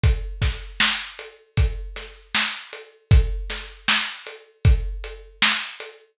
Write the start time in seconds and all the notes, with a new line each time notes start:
0.04 kick, closed hi-hat
0.42 kick, snare, closed hi-hat
0.80 snare
1.19 closed hi-hat
1.57 kick, closed hi-hat
1.96 snare, closed hi-hat
2.35 snare
2.73 closed hi-hat
3.11 kick, closed hi-hat
3.50 snare, closed hi-hat
3.88 snare
4.27 closed hi-hat
4.65 kick, closed hi-hat
5.04 closed hi-hat
5.42 snare
5.80 closed hi-hat